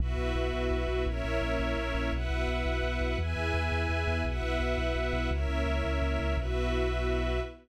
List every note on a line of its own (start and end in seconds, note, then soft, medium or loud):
0.00 0.15 B1 medium
0.00 1.05 B3 medium
0.00 1.05 E4 medium
0.00 1.05 F#4 loud
0.00 1.05 F#4 medium
0.00 1.05 B4 medium
0.00 1.05 E5 medium
0.18 0.33 B1 medium
0.35 0.50 B1 medium
0.53 0.68 B1 medium
0.71 0.86 B1 medium
0.88 1.03 B1 medium
1.05 1.21 A#1 medium
1.05 2.11 A#3 medium
1.05 2.11 C#4 loud
1.05 2.11 E4 loud
1.05 2.11 A#4 medium
1.05 2.11 C#5 loud
1.05 2.11 E5 medium
1.24 1.39 A#1 medium
1.42 1.57 A#1 medium
1.59 1.74 A#1 medium
1.77 1.92 A#1 medium
1.95 2.10 A#1 medium
2.12 2.28 B1 medium
2.12 3.18 B3 medium
2.12 3.18 E4 medium
2.12 3.18 F#4 medium
2.12 3.18 B4 medium
2.12 3.18 E5 medium
2.12 3.18 F#5 medium
2.30 2.45 B1 medium
2.48 2.63 B1 medium
2.66 2.81 B1 medium
2.83 2.98 B1 medium
3.01 3.16 B1 medium
3.19 3.34 E2 medium
3.19 4.25 B3 medium
3.19 4.25 E4 medium
3.19 4.25 G#4 medium
3.19 4.24 B4 medium
3.19 4.24 E5 medium
3.19 4.24 G#5 medium
3.36 3.51 E2 medium
3.54 3.69 E2 medium
3.72 3.87 E2 medium
3.89 4.05 E2 medium
4.07 4.22 E2 medium
4.25 4.40 B1 medium
4.25 5.30 B3 medium
4.25 5.30 E4 medium
4.25 5.30 F#4 medium
4.25 5.30 B4 medium
4.25 5.30 E5 medium
4.25 5.30 F#5 medium
4.42 4.58 B1 medium
4.60 4.75 B1 medium
4.78 4.93 B1 medium
4.96 5.11 B1 medium
5.13 5.28 B1 medium
5.30 5.46 C#2 loud
5.30 6.36 A#3 medium
5.30 6.36 C#4 medium
5.30 6.36 E4 medium
5.30 6.36 A#4 medium
5.30 6.36 C#5 medium
5.30 6.36 E5 loud
5.49 5.64 C#2 medium
5.66 5.81 C#2 medium
5.84 5.99 C#2 medium
6.02 6.17 C#2 medium
6.19 6.35 C#2 medium
6.37 7.40 B1 loud
6.37 7.40 B3 loud
6.37 7.40 E4 medium
6.37 7.40 F#4 medium
6.37 7.40 F#4 loud
6.37 7.40 B4 medium
6.37 7.40 E5 medium